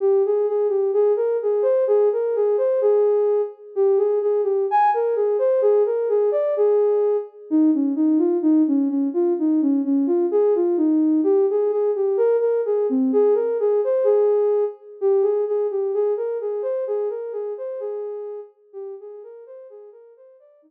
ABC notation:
X:1
M:2/4
L:1/8
Q:1/4=128
K:Eb
V:1 name="Ocarina"
G A A G | A B A c | A B A c | A3 z |
G A A G | a B A c | A B A d | A3 z |
[K:Ab] E D E F | E D D F | E D D F | A F E2 |
[K:Eb] G A A G | B B A C | A B A c | A3 z |
G A A G | A B A c | A B A c | A3 z |
G A B c | A B c d | E2 z2 |]